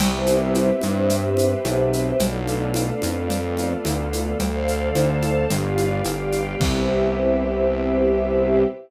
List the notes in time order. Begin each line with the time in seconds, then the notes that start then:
0.00 C2 B3 C4 E4 G4 B4 C5 E5, crash, cowbell, low conga, shaker
0.26 high conga, shaker
0.54 cowbell, high conga, shaker
0.81 G2, high conga, shaker
1.10 B3 C4 G4 B4, cowbell, low conga, shaker
1.37 high conga, shaker
1.65 B1, cowbell, high conga, shaker
1.93 shaker
2.19 B1 A3 B3 D4 F4 A4 B4 D5 F5, cowbell, low conga, shaker
2.47 high conga, shaker
2.74 cowbell, high conga, shaker
3.02 F2, high conga, shaker
3.30 A3 B3 F4 A4, cowbell, low conga, shaker
3.57 high conga, shaker
3.85 D2, cowbell, high conga, shaker
4.13 high conga, shaker
4.39 D2 A4 C5 D5 F5, cowbell, low conga, shaker
4.68 shaker
4.94 D2 A4 C5 F5 A5, cowbell, high conga, shaker
5.22 high conga, shaker
5.50 G1 G4 B4 D5 F5, cowbell, low conga, shaker
5.78 high conga, shaker
6.04 G1 G4 B4 F5 G5, cowbell, high conga, shaker
6.32 high conga, shaker
6.60 C2 B3 C4 E4 G4 B4 C5 E5, kick, crash